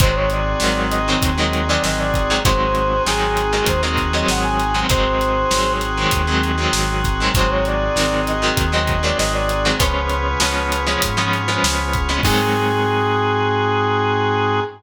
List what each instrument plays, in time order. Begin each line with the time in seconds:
0.00 synth bass 1 G#1, overdriven guitar D#3 F#3 G#3 C4, drawbar organ C4 D#4 F#4 G#4, brass section C5, kick, closed hi-hat
0.15 brass section C#5
0.30 brass section D5, closed hi-hat
0.60 synth bass 1 G#1, overdriven guitar D#3 F#3 G#3 C4, snare
0.90 brass section D#5, closed hi-hat
1.08 overdriven guitar D#3 F#3 G#3 C4
1.22 synth bass 1 D#2, kick, closed hi-hat
1.38 overdriven guitar D#3 F#3 G#3 C4, brass section D#5
1.53 closed hi-hat
1.68 overdriven guitar D#3 F#3 G#3 C4, brass section D5
1.84 synth bass 1 G#1, brass section D#5, snare
1.99 brass section D5
2.14 kick, closed hi-hat
2.30 overdriven guitar D#3 F#3 G#3 C4
2.45 synth bass 1 G#1, overdriven guitar D#3 F#3 G#3 C4, drawbar organ C4 D#4 F#4 G#4, brass section C5, kick, closed hi-hat
2.75 closed hi-hat
3.06 synth bass 1 G#1, overdriven guitar D#3 F#3 G#3 C4, brass section G#4, snare
3.37 closed hi-hat
3.53 overdriven guitar D#3 F#3 G#3 C4
3.66 synth bass 1 D#2, brass section C5, kick, closed hi-hat
3.83 overdriven guitar D#3 F#3 G#3 C4
3.97 kick, closed hi-hat
4.13 overdriven guitar D#3 F#3 G#3 C4, brass section D#5
4.28 synth bass 1 G#1, brass section F#5, snare
4.43 brass section G#5
4.60 closed hi-hat
4.74 overdriven guitar D#3 F#3 G#3 C4
4.89 synth bass 1 G#1, overdriven guitar D#3 F#3 G#3 C4, drawbar organ C4 D#4 F#4 G#4, brass section C5, kick, closed hi-hat
5.21 closed hi-hat
5.51 synth bass 1 G#1, overdriven guitar D#3 F#3 G#3 C4, snare
5.81 closed hi-hat
5.97 overdriven guitar D#3 F#3 G#3 C4
6.11 synth bass 1 D#2, kick, closed hi-hat
6.27 overdriven guitar D#3 F#3 G#3 C4
6.43 closed hi-hat
6.58 overdriven guitar D#3 F#3 G#3 C4
6.73 synth bass 1 G#1, snare
7.04 kick, closed hi-hat
7.20 overdriven guitar D#3 F#3 G#3 C4
7.35 synth bass 1 G#1, overdriven guitar D#3 F#3 G#3 C4, drawbar organ C4 D#4 F#4 G#4, brass section C5, kick, closed hi-hat
7.50 brass section C#5
7.65 brass section D5, closed hi-hat
7.96 synth bass 1 G#1, overdriven guitar D#3 F#3 G#3 C4, snare
8.27 brass section D#5, closed hi-hat
8.42 overdriven guitar D#3 F#3 G#3 C4
8.57 synth bass 1 D#2, kick, closed hi-hat
8.72 overdriven guitar D#3 F#3 G#3 C4, brass section D#5
8.87 kick, closed hi-hat
9.03 overdriven guitar D#3 F#3 G#3 C4, brass section D5
9.18 synth bass 1 G#1, brass section D#5, snare
9.33 brass section D5
9.49 closed hi-hat
9.65 overdriven guitar D#3 F#3 G#3 C4
9.79 synth bass 1 C#2, overdriven guitar F3 G#3 B3 C#4, drawbar organ B3 C#4 F4 G#4, brass section B4, kick, closed hi-hat
10.09 closed hi-hat
10.40 synth bass 1 C#2, overdriven guitar F3 G#3 B3 C#4, snare
10.72 closed hi-hat
10.87 overdriven guitar F3 G#3 B3 C#4
11.02 synth bass 1 G#2, kick, closed hi-hat
11.17 overdriven guitar F3 G#3 B3 C#4
11.33 closed hi-hat
11.48 overdriven guitar F3 G#3 B3 C#4
11.63 synth bass 1 C#2, snare
11.93 kick, closed hi-hat
12.09 overdriven guitar F3 G#3 B3 C#4
12.23 synth bass 1 G#2, overdriven guitar D#3 F#3 G#3 C4, drawbar organ C4 D#4 F#4 G#4, brass section G#4, kick, crash